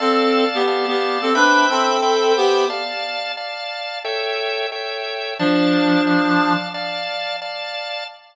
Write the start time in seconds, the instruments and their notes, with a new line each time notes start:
0.00 clarinet C4 A4, drawbar organ D5 F5 A5
0.55 clarinet B3 G4
0.67 drawbar organ D5 F5 A5
0.88 clarinet B3 G4
1.22 clarinet C4 A4
1.35 clarinet D4 B4, drawbar organ C5 E5 G5 B5
1.70 clarinet C4 A4
2.02 drawbar organ C5 E5 G5 B5
2.37 clarinet B3 G4
2.70 drawbar organ D5 F5 A5
3.37 drawbar organ D5 F5 A5
4.04 drawbar organ A4 C#5 E5 G5
4.72 drawbar organ A4 C#5 E5 G5
5.39 clarinet F3 D4, drawbar organ D5 F5 A5
6.07 drawbar organ D5 F5 A5
6.74 drawbar organ D5 F5 A5
7.42 drawbar organ D5 F5 A5